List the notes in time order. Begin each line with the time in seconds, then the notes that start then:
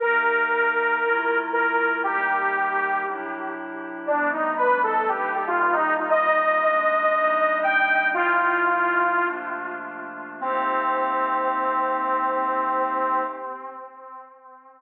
0.00 C3 A#3 D#4 G4 A#4
1.02 C3 A3 E4 F4
1.53 A#4
2.03 C3 G3 A#3 D#4 G4
3.05 C3 F#3 D4 E4
4.07 C3 F3 G3 A3 B3 D4
4.32 D#4
4.57 B4
4.83 A4
5.08 C3 G3 A#3 D#4 G4
5.34 G4
5.47 F4
5.59 F4
5.73 D#4
5.97 D#4
6.10 C3 G3 A#3 D#4 D#5
6.61 C3 G#3 A#3 D4
7.12 C3 G3 A#3 D4 D#4
7.63 G5
8.14 C3 F3 A3 E4 F4
9.20 C3 F3 A3 A#3 D4
10.40 C3 A#3 C4 D#4 G4